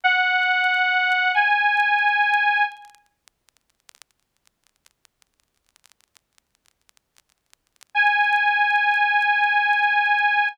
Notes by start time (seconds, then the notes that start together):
0.04 F#5
1.34 G#5
7.95 G#5